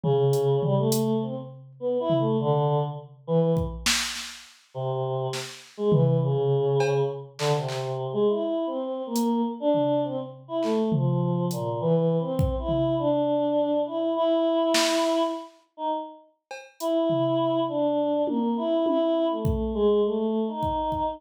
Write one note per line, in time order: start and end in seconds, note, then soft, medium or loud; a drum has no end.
0.04 0.56 C#3 loud
0.04 floor tom medium
0.33 closed hi-hat medium
0.62 0.76 G3 loud
0.62 floor tom medium
0.77 1.17 A3 loud
0.92 closed hi-hat loud
1.22 1.35 C4 medium
1.80 1.98 B3 medium
2.00 2.18 E4 loud
2.10 floor tom medium
2.19 2.37 A3 loud
2.39 2.79 D3 loud
3.27 3.54 E3 loud
3.57 kick medium
3.86 snare loud
4.16 snare medium
4.74 5.27 C3 medium
5.33 snare medium
5.77 5.91 G#3 medium
5.92 6.18 E3 loud
5.92 floor tom loud
6.21 7.01 C#3 medium
6.80 cowbell loud
7.39 7.52 D3 medium
7.39 clap medium
7.54 8.07 C3 medium
7.69 clap medium
8.13 8.26 G#3 loud
8.27 8.63 E4 medium
8.67 9.02 C4 medium
9.06 9.42 A#3 loud
9.16 closed hi-hat medium
9.60 10.00 D4 loud
9.74 floor tom medium
10.04 10.17 C4 medium
10.48 10.61 E4 medium
10.63 10.89 A3 medium
10.63 clap medium
10.92 11.45 F3 soft
10.92 floor tom medium
11.51 11.78 A#2 soft
11.51 closed hi-hat medium
11.81 12.16 E3 loud
12.20 12.55 C4 loud
12.39 kick loud
12.59 12.94 E4 medium
12.69 floor tom medium
12.98 13.78 D4 medium
13.86 14.13 E4 medium
14.16 15.22 E4 loud
14.74 snare loud
15.77 15.90 D#4 medium
16.51 cowbell medium
16.80 17.60 E4 medium
16.80 closed hi-hat medium
17.10 floor tom medium
17.68 18.21 D4 medium
18.27 18.54 A#3 medium
18.27 high tom medium
18.57 18.83 E4 medium
18.86 19.26 E4 loud
18.86 high tom medium
19.30 19.70 A3 soft
19.45 kick medium
19.75 20.01 G#3 loud
20.04 20.44 A3 medium
20.48 21.14 D#4 medium
20.63 kick medium
20.92 kick medium